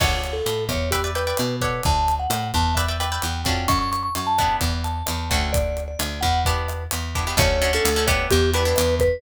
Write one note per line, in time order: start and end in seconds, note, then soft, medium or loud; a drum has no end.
0.00 0.41 D2 medium
0.00 0.37 C#5 medium
0.00 0.35 C#5 medium
0.00 0.37 D5 medium
0.00 0.37 F#5 medium
0.00 0.37 A5 medium
0.00 kick loud
0.00 cross-stick loud
0.00 crash loud
0.24 closed hi-hat medium
0.33 0.64 A4 medium
0.46 0.68 A2 medium
0.46 closed hi-hat medium
0.69 1.33 E2 medium
0.69 0.89 C#5 medium
0.69 kick medium
0.69 cross-stick medium
0.69 closed hi-hat medium
0.91 1.10 G4 medium
0.91 1.02 B4 medium
0.91 1.02 D5 medium
0.91 1.02 E5 medium
0.91 1.02 G5 medium
0.91 kick medium
0.91 closed hi-hat loud
1.04 1.13 B4 medium
1.04 1.13 D5 medium
1.04 1.13 E5 medium
1.04 1.13 G5 medium
1.15 1.24 B4 medium
1.15 1.56 B4 medium
1.15 1.24 D5 medium
1.15 1.24 E5 medium
1.15 1.24 G5 medium
1.15 closed hi-hat medium
1.27 1.55 B4 medium
1.27 1.55 D5 medium
1.27 1.55 E5 medium
1.27 1.55 G5 medium
1.37 1.81 B2 medium
1.37 cross-stick medium
1.37 closed hi-hat loud
1.61 2.22 A4 medium
1.61 1.82 B4 medium
1.61 2.22 C#5 medium
1.61 2.22 D5 medium
1.61 2.22 F#5 medium
1.61 kick medium
1.61 closed hi-hat medium
1.83 2.27 D2 medium
1.83 2.14 A5 medium
1.83 kick medium
1.83 closed hi-hat medium
2.08 closed hi-hat medium
2.19 2.48 F#5 medium
2.30 2.52 A2 medium
2.30 cross-stick medium
2.30 closed hi-hat loud
2.54 3.19 E2 medium
2.54 2.75 A5 medium
2.54 kick medium
2.54 closed hi-hat medium
2.75 2.86 B4 medium
2.75 2.86 D5 medium
2.75 2.97 E5 medium
2.75 2.86 E5 medium
2.75 2.86 G5 medium
2.75 kick medium
2.75 closed hi-hat medium
2.88 2.98 B4 medium
2.88 2.98 D5 medium
2.88 2.98 E5 medium
2.88 2.98 G5 medium
3.00 3.09 B4 medium
3.00 3.09 D5 medium
3.00 3.09 E5 medium
3.00 3.42 G5 medium
3.00 3.09 G5 medium
3.00 cross-stick medium
3.00 closed hi-hat medium
3.12 3.39 B4 medium
3.12 3.39 D5 medium
3.12 3.39 E5 medium
3.12 3.39 G5 medium
3.22 3.44 E2 medium
3.22 closed hi-hat medium
3.44 3.66 F2 medium
3.44 4.06 C#4 medium
3.44 4.06 D4 medium
3.44 4.06 F#4 medium
3.44 4.06 A4 medium
3.44 3.67 G5 medium
3.44 kick medium
3.44 closed hi-hat medium
3.68 4.10 F#2 medium
3.68 3.79 C#6 medium
3.68 kick medium
3.68 cross-stick loud
3.68 closed hi-hat medium
3.79 3.90 C#6 medium
3.92 4.02 C#6 medium
3.92 closed hi-hat medium
4.03 4.14 C#6 medium
4.15 4.57 F#2 medium
4.15 4.28 C#6 medium
4.15 closed hi-hat medium
4.27 4.56 A5 medium
4.38 4.99 B3 medium
4.38 4.99 D4 medium
4.38 4.99 E4 medium
4.38 4.99 G4 medium
4.38 kick medium
4.38 cross-stick medium
4.38 closed hi-hat medium
4.61 5.03 E2 medium
4.61 kick medium
4.61 closed hi-hat medium
4.84 5.28 A5 medium
4.84 closed hi-hat medium
5.06 5.30 E2 medium
5.06 cross-stick medium
5.06 closed hi-hat loud
5.30 5.96 D2 medium
5.30 5.91 A3 medium
5.30 5.91 C#4 medium
5.30 5.91 D4 medium
5.30 5.91 F#4 medium
5.30 5.52 G5 medium
5.30 kick medium
5.30 closed hi-hat medium
5.53 5.83 D5 medium
5.53 kick medium
5.53 closed hi-hat loud
5.77 closed hi-hat medium
5.88 6.20 D5 medium
5.99 6.21 D2 medium
5.99 cross-stick medium
5.99 closed hi-hat loud
6.21 6.87 E2 medium
6.21 6.40 F#5 medium
6.21 kick medium
6.21 closed hi-hat medium
6.45 6.83 B3 medium
6.45 6.83 D4 medium
6.45 6.83 E4 medium
6.45 6.83 G4 medium
6.45 6.84 B4 medium
6.45 kick medium
6.45 closed hi-hat medium
6.68 cross-stick medium
6.68 closed hi-hat medium
6.91 7.34 E2 medium
6.91 closed hi-hat loud
7.15 7.24 B3 medium
7.15 7.24 D4 medium
7.15 7.24 E4 medium
7.15 7.24 G4 medium
7.15 kick medium
7.15 closed hi-hat medium
7.27 7.36 B3 medium
7.27 7.36 D4 medium
7.27 7.36 E4 medium
7.27 7.36 G4 medium
7.37 7.79 D2 loud
7.37 7.57 A3 medium
7.37 7.57 C#4 medium
7.37 7.57 D4 medium
7.37 7.57 F#4 medium
7.37 7.72 C#5 loud
7.37 kick loud
7.37 cross-stick loud
7.37 closed hi-hat loud
7.62 7.71 A3 medium
7.62 7.71 C#4 medium
7.62 7.71 D4 medium
7.62 7.71 F#4 medium
7.62 closed hi-hat medium
7.73 7.92 A3 medium
7.73 7.92 C#4 medium
7.73 7.92 D4 medium
7.73 7.92 F#4 medium
7.73 8.06 A4 medium
7.85 8.26 D2 medium
7.85 closed hi-hat loud
7.96 8.07 A3 medium
7.96 8.07 C#4 medium
7.96 8.07 D4 medium
7.96 8.07 F#4 medium
8.07 8.49 B3 loud
8.07 8.49 D4 medium
8.07 8.49 E4 medium
8.07 8.49 G4 loud
8.07 8.26 C#5 loud
8.07 kick medium
8.07 cross-stick loud
8.07 closed hi-hat medium
8.31 8.74 E2 loud
8.31 8.50 G4 loud
8.31 kick medium
8.31 closed hi-hat medium
8.54 8.63 B3 medium
8.54 8.63 D4 medium
8.54 8.63 E4 medium
8.54 8.63 G4 medium
8.54 8.95 B4 medium
8.54 closed hi-hat medium
8.65 9.02 B3 medium
8.65 9.02 D4 medium
8.65 9.02 E4 medium
8.65 9.02 G4 medium
8.76 9.19 E2 medium
8.76 cross-stick medium
8.76 closed hi-hat loud
9.00 9.21 B4 loud
9.00 kick medium
9.00 closed hi-hat medium